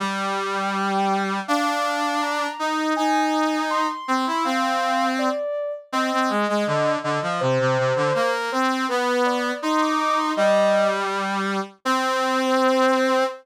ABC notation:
X:1
M:2/2
L:1/8
Q:1/2=81
K:Eb
V:1 name="Ocarina"
g8 | f4 b4 | a4 c'4 | f4 d3 z |
[K:Cm] e6 e2 | c6 c2 | =B2 d2 c' d' d' c' | e3 z5 |
c8 |]
V:2 name="Brass Section"
G,8 | D6 E2 | E6 C =E | C5 z3 |
[K:Cm] C C A, A, D,2 D, F, | C, C, C, D, B,2 C2 | =B,4 E4 | G,7 z |
C8 |]